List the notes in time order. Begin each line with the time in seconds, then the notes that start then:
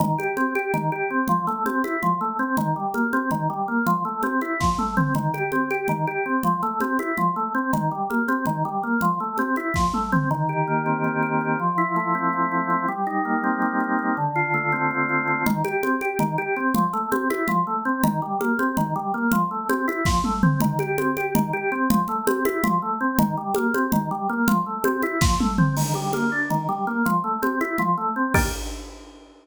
0.00 D#3, low conga
0.18 G4, high conga
0.37 C4, high conga
0.55 G4, high conga
0.74 D#3, low conga
0.92 G4
1.10 C4
1.28 F3, low conga
1.47 A3, low conga
1.66 C4, high conga
1.84 E4, high conga
2.02 F3, low conga
2.21 A3
2.39 C4
2.57 D#3, low conga
2.76 G3
2.94 A#3, high conga
3.13 C4, high conga
3.31 D#3, low conga
3.50 G3
3.68 A#3
3.87 F3, low conga
4.05 A3
4.23 C4, high conga
4.41 E4, high conga
4.60 F3, kick, snare
4.78 A3, high tom
4.97 C4, mid tom
5.15 D#3, low conga
5.34 G4, high conga
5.52 C4, high conga
5.71 G4, high conga
5.88 D#3, low conga
6.07 G4
6.26 C4
6.43 F3, low conga
6.63 A3, low conga
6.80 C4, high conga
6.99 E4, high conga
7.17 F3, low conga
7.36 A3
7.55 C4
7.73 D#3, low conga
7.91 G3
8.10 A#3, high conga
8.28 C4, high conga
8.46 D#3, low conga
8.65 G3
8.83 A#3
9.01 F3, low conga
9.20 A3
9.38 C4, high conga
9.56 E4, high conga
9.74 F3, kick, snare
9.94 A3, high tom
10.12 C4, mid tom
10.31 D#3
10.49 G4
10.67 A#3
10.86 C4
11.04 D#3
11.23 G4
11.41 C4
11.60 F3
11.78 E4
11.96 A3
12.15 C4
12.33 F3
12.52 E4
12.70 C4
12.88 G3
13.07 D#4
13.25 A#3
13.44 C4
13.62 G3
13.80 D#4
13.99 C4
14.17 D3
14.36 F4
14.54 A3
14.72 C4
14.91 D3
15.09 F4
15.28 C4
15.46 D#3, low conga
15.64 G4, high conga
15.83 C4, high conga
16.01 G4, high conga
16.19 D#3, low conga
16.38 G4
16.56 C4
16.75 F3, low conga
16.93 A3, low conga
17.12 C4, high conga
17.30 E4, high conga
17.48 F3, low conga
17.67 A3
17.85 C4
18.04 D#3, low conga
18.22 G3
18.40 A#3, high conga
18.59 C4, high conga
18.77 D#3, low conga
18.96 G3
19.14 A#3
19.32 F3, low conga
19.51 A3
19.69 C4, high conga
19.88 E4, high conga
20.05 F3, kick, snare
20.24 A3, high tom
20.43 C4, mid tom
20.60 D#3, low conga
20.79 G4, high conga
20.98 C4, high conga
21.16 G4, high conga
21.35 D#3, low conga
21.53 G4
21.72 C4
21.90 F3, low conga
22.08 A3, low conga
22.27 C4, high conga
22.45 E4, high conga
22.64 F3, low conga
22.82 A3
23.01 C4
23.19 D#3, low conga
23.37 G3
23.55 A#3, high conga
23.74 C4, high conga
23.92 D#3, low conga
24.11 G3
24.29 A#3
24.48 F3, low conga
24.66 A3
24.84 C4, high conga
25.02 E4, high conga
25.21 F3, kick, snare
25.40 A3, high tom
25.58 C4, mid tom
25.77 D#3, crash, low conga
25.94 G3, high conga
26.13 A#3, high conga
26.32 D4
26.50 D#3, low conga
26.69 G3
26.87 A#3
27.06 F3, low conga
27.24 A3
27.42 C4, high conga
27.61 E4, high conga
27.78 F3, low conga
27.98 A3
28.16 C4
28.34 D#3 A#3 D4 G4, kick, crash